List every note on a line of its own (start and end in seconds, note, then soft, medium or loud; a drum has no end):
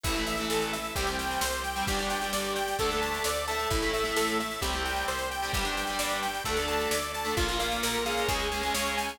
0.03 0.45 A1 loud
0.03 0.13 E3 loud
0.03 0.13 A3 loud
0.03 0.25 E4 medium
0.03 0.94 E4 loud
0.03 0.94 A4 medium
0.03 kick medium
0.03 snare medium
0.03 crash medium
0.15 0.33 E3 loud
0.15 0.33 A3 medium
0.15 snare medium
0.27 0.48 E5 medium
0.27 snare medium
0.37 0.75 E3 medium
0.37 0.75 A3 medium
0.37 snare medium
0.50 0.91 A1 medium
0.50 0.71 A4 medium
0.50 snare medium
0.62 snare medium
0.73 0.94 E5 soft
0.73 snare medium
0.85 snare medium
0.95 1.37 C2 loud
0.95 1.05 G3 loud
0.95 1.05 C4 loud
0.95 1.85 G4 medium
0.95 1.17 G4 medium
0.95 1.85 C5 medium
0.95 kick medium
0.95 snare medium
1.07 1.43 G3 medium
1.07 1.43 C4 medium
1.07 snare medium
1.19 1.40 G5 medium
1.19 snare medium
1.31 snare medium
1.41 1.83 C2 medium
1.41 1.62 C5 medium
1.41 snare loud
1.53 snare medium
1.64 1.85 G5 medium
1.64 snare medium
1.76 1.85 G3 medium
1.76 1.85 C4 medium
1.76 snare medium
1.87 2.29 G1 loud
1.87 1.97 G3 loud
1.87 1.97 D4 loud
1.87 2.77 G4 medium
1.87 2.09 G4 medium
1.87 2.77 D5 medium
1.87 kick medium
1.87 snare medium
1.99 2.17 G3 medium
1.99 2.17 D4 medium
1.99 snare medium
2.10 2.31 G5 medium
2.10 snare medium
2.22 2.58 G3 loud
2.22 2.58 D4 medium
2.22 snare medium
2.33 2.74 G1 medium
2.33 2.54 D5 medium
2.33 snare medium
2.45 snare medium
2.56 2.77 G5 medium
2.56 snare medium
2.68 snare medium
2.79 3.20 D2 loud
2.79 2.89 A3 loud
2.79 2.89 D4 loud
2.79 3.00 A4 medium
2.79 3.45 A4 loud
2.79 3.45 D5 medium
2.79 kick medium
2.79 snare medium
2.91 3.27 A3 loud
2.91 3.27 D4 medium
2.91 snare medium
3.02 3.23 A5 medium
3.02 snare medium
3.14 snare medium
3.24 3.66 D2 medium
3.24 3.46 D5 medium
3.24 snare loud
3.36 snare medium
3.47 3.81 A3 loud
3.47 3.81 E4 loud
3.47 4.60 A4 loud
3.47 4.60 E5 medium
3.47 3.69 A5 medium
3.47 snare medium
3.60 snare medium
3.70 4.12 A1 loud
3.70 3.91 E4 medium
3.70 kick medium
3.70 snare medium
3.82 4.01 A3 medium
3.82 4.01 E4 medium
3.82 snare medium
3.93 4.14 E5 medium
3.93 snare medium
4.04 4.40 A3 medium
4.04 4.40 E4 medium
4.04 snare medium
4.16 4.58 A1 medium
4.16 4.38 A4 medium
4.16 snare loud
4.28 snare medium
4.40 4.61 E5 soft
4.40 snare medium
4.51 snare medium
4.61 5.03 C2 loud
4.61 4.70 G3 loud
4.61 4.70 C4 loud
4.61 5.51 G4 medium
4.61 4.83 G4 medium
4.61 5.51 C5 medium
4.61 kick medium
4.61 snare medium
4.73 5.11 G3 medium
4.73 5.11 C4 loud
4.73 snare medium
4.85 5.06 G5 medium
4.85 snare medium
4.96 snare medium
5.08 5.49 C2 medium
5.08 5.29 C5 medium
5.08 snare medium
5.19 snare medium
5.31 5.52 G5 medium
5.31 snare medium
5.42 5.52 G3 medium
5.42 5.52 C4 medium
5.42 snare medium
5.52 5.95 G1 loud
5.52 5.62 G3 loud
5.52 5.62 D4 loud
5.52 6.42 G4 medium
5.52 5.75 G4 medium
5.52 6.42 D5 medium
5.52 kick medium
5.52 snare medium
5.64 5.82 G3 medium
5.64 5.82 D4 medium
5.64 snare medium
5.77 5.98 G5 soft
5.77 snare medium
5.87 6.25 G3 medium
5.87 6.25 D4 medium
5.87 snare medium
5.99 6.41 G1 medium
5.99 6.21 D5 medium
5.99 snare loud
6.10 snare medium
6.22 6.43 G5 medium
6.22 snare medium
6.34 snare medium
6.44 6.87 D2 loud
6.44 6.54 A3 loud
6.44 6.54 D4 loud
6.44 6.66 A4 medium
6.44 7.35 A4 medium
6.44 7.35 D5 loud
6.44 kick medium
6.44 snare medium
6.57 6.95 A3 loud
6.57 6.95 D4 medium
6.57 snare medium
6.68 6.89 A5 medium
6.68 snare medium
6.80 snare medium
6.91 7.32 D2 medium
6.91 7.12 D5 medium
6.91 snare loud
7.02 snare medium
7.14 7.35 A5 medium
7.14 snare medium
7.25 7.34 A3 medium
7.25 7.34 D4 medium
7.25 snare medium
7.37 7.78 A#1 loud
7.37 7.46 A#3 loud
7.37 7.58 F4 medium
7.37 8.28 F4 loud
7.37 7.46 F4 loud
7.37 8.28 A#4 loud
7.37 kick medium
7.37 snare medium
7.49 7.58 A#3 loud
7.49 7.58 F4 loud
7.49 snare medium
7.59 7.96 A#3 loud
7.59 7.96 F4 loud
7.59 7.81 F5 medium
7.59 snare medium
7.71 snare medium
7.83 8.24 A#1 medium
7.83 8.04 A#4 medium
7.83 snare loud
7.94 snare medium
8.05 8.46 G#3 loud
8.05 8.46 C#4 loud
8.05 8.27 F5 medium
8.05 snare medium
8.17 snare medium
8.28 8.70 C#2 loud
8.28 8.49 G#4 medium
8.28 9.19 G#4 loud
8.28 9.19 C#5 loud
8.28 kick medium
8.28 snare medium
8.39 snare medium
8.52 8.61 G#3 medium
8.52 8.61 C#4 medium
8.52 8.73 G#5 soft
8.52 snare medium
8.63 8.72 G#3 medium
8.63 8.72 C#4 loud
8.63 snare medium
8.74 9.16 C#2 medium
8.74 9.11 G#3 medium
8.74 9.11 C#4 loud
8.74 8.95 C#5 medium
8.74 snare loud
8.86 snare medium
8.97 9.18 G#5 medium
8.97 snare medium
9.09 snare medium